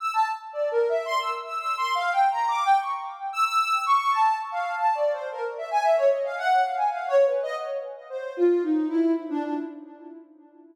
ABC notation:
X:1
M:3/4
L:1/16
Q:1/4=113
K:none
V:1 name="Ocarina"
e' a z2 (3d2 ^A2 e2 c' e' z e' | (3e'2 c'2 f2 (3g2 ^a2 d'2 g ^c' z2 | z e' e'3 ^c'2 a2 z f2 | (3a2 d2 c2 ^A z e ^g e ^c ^d f |
^f2 =f ^g (3f2 ^c2 B2 ^d z3 | z c2 F2 ^D2 E2 z =D D |]